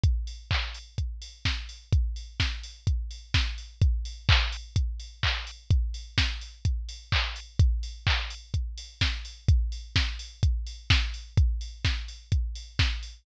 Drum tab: HH |xo-oxo-o|xo-oxo-o|xo-oxo-o|xo-oxo-o|
CP |--x-----|--------|--x---x-|------x-|
SD |------o-|--o---o-|--------|--o-----|
BD |o-o-o-o-|o-o-o-o-|o-o-o-o-|o-o-o-o-|

HH |xo-oxo-o|xo-oxo-o|xo-oxo-o|
CP |--x-----|--------|--------|
SD |------o-|--o---o-|--o---o-|
BD |o-o-o-o-|o-o-o-o-|o-o-o-o-|